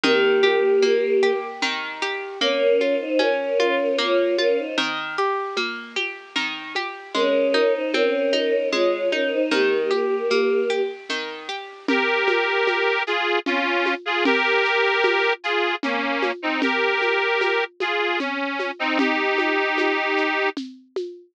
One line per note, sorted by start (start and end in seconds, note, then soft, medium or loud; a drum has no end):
0.03 1.62 D#3 loud
0.03 1.32 A#3 medium
0.03 1.32 G4 medium
0.03 low conga medium
0.03 shaker medium
0.43 1.22 G4 medium
0.43 high conga medium
0.43 shaker medium
0.82 2.32 A#3 medium
0.82 high conga medium
0.82 shaker medium
1.23 2.01 G4 medium
1.23 shaker medium
1.62 2.37 D#3 medium
1.62 low conga medium
1.62 shaker medium
2.02 2.39 G4 medium
2.02 shaker medium
2.41 2.81 A#3 medium
2.41 2.94 C#4 medium
2.41 2.94 A#4 medium
2.41 low conga medium
2.41 shaker medium
2.80 3.20 F4 medium
2.80 high conga soft
2.80 shaker medium
3.00 3.19 D#4 medium
3.00 3.19 C5 medium
3.19 3.59 C#4 medium
3.19 3.96 C#4 medium
3.19 3.96 A#4 medium
3.19 high conga medium
3.19 shaker medium
3.59 3.99 F4 medium
3.59 high conga medium
3.59 shaker soft
3.98 4.38 A#3 medium
3.98 4.35 F4 medium
3.98 4.35 C#5 medium
3.98 low conga medium
3.98 shaker medium
4.38 4.57 C#4 medium
4.38 4.76 F4 medium
4.38 4.57 A#4 medium
4.38 high conga medium
4.38 shaker soft
4.58 4.77 D#4 medium
4.58 4.77 C5 medium
4.78 5.17 D#3 medium
4.78 low conga medium
4.78 shaker medium
5.17 5.58 G4 medium
5.17 shaker medium
5.57 5.96 A#3 medium
5.57 high conga medium
5.57 shaker medium
5.96 6.36 G4 medium
5.96 high conga soft
5.96 shaker medium
6.36 6.75 D#3 medium
6.36 low conga medium
6.36 shaker medium
6.75 7.13 G4 medium
6.75 high conga medium
6.75 shaker medium
7.14 7.54 G#3 medium
7.14 7.73 C#4 medium
7.14 7.73 A#4 medium
7.14 low conga medium
7.14 shaker medium
7.54 7.94 D#4 medium
7.54 high conga medium
7.54 shaker soft
7.74 7.93 D#4 medium
7.74 7.93 C5 medium
7.93 8.34 C4 medium
7.93 8.68 C#4 medium
7.93 8.68 A#4 medium
7.93 high conga medium
7.93 shaker medium
8.33 8.72 D#4 medium
8.33 high conga soft
8.33 shaker soft
8.72 9.12 G#3 medium
8.72 9.08 F4 medium
8.72 9.08 C#5 medium
8.72 low conga medium
8.72 shaker medium
9.12 9.31 C#4 medium
9.12 9.50 D#4 medium
9.12 9.31 A#4 medium
9.12 high conga soft
9.12 shaker soft
9.32 9.50 D#4 medium
9.32 9.50 C5 medium
9.51 9.91 D#3 medium
9.51 10.80 A#3 medium
9.51 10.80 G4 medium
9.51 low conga medium
9.51 shaker medium
9.91 10.30 G4 medium
9.91 high conga medium
9.91 shaker medium
10.30 10.70 A#3 medium
10.30 high conga medium
10.30 shaker medium
10.70 11.09 G4 medium
10.70 shaker soft
11.09 11.49 D#3 medium
11.09 low conga soft
11.09 shaker medium
11.49 11.86 G4 medium
11.49 shaker medium
11.88 13.03 G4 medium
11.88 13.03 A#4 loud
11.88 low conga loud
11.88 shaker medium
12.28 high conga medium
12.28 shaker medium
12.67 high conga medium
12.67 shaker medium
13.07 13.39 F4 medium
13.07 13.39 G#4 loud
13.07 shaker medium
13.46 13.94 C#4 medium
13.46 13.94 F4 loud
13.46 low conga medium
13.46 shaker medium
13.86 high conga medium
13.86 shaker medium
14.05 14.24 F4 medium
14.05 14.24 G#4 loud
14.25 15.33 G4 loud
14.25 15.33 A#4 loud
14.25 low conga loud
14.25 shaker medium
14.65 shaker medium
15.04 high conga medium
15.04 shaker medium
15.44 15.75 F4 medium
15.44 15.75 G#4 medium
15.44 shaker medium
15.83 16.32 A#3 medium
15.83 16.32 C#4 medium
15.83 low conga medium
15.83 shaker medium
16.22 high conga medium
16.22 shaker medium
16.42 16.61 C4 medium
16.42 16.61 D#4 medium
16.62 17.64 G4 medium
16.62 17.64 A#4 loud
16.62 low conga medium
16.62 shaker medium
17.01 high conga medium
17.01 shaker medium
17.41 high conga medium
17.41 shaker medium
17.80 18.19 F4 medium
17.80 18.19 G#4 medium
17.80 high conga medium
17.80 shaker medium
18.20 18.71 C#4 medium
18.20 low conga medium
18.20 shaker medium
18.59 high conga medium
18.59 shaker medium
18.79 18.98 C4 medium
18.79 18.98 D#4 loud
18.99 20.49 D#4 medium
18.99 20.49 G4 loud
18.99 low conga loud
18.99 shaker medium
19.38 high conga medium
19.38 shaker medium
19.78 high conga medium
19.78 shaker medium
20.17 shaker medium
20.57 low conga medium
20.57 shaker medium
20.96 high conga medium
20.96 shaker medium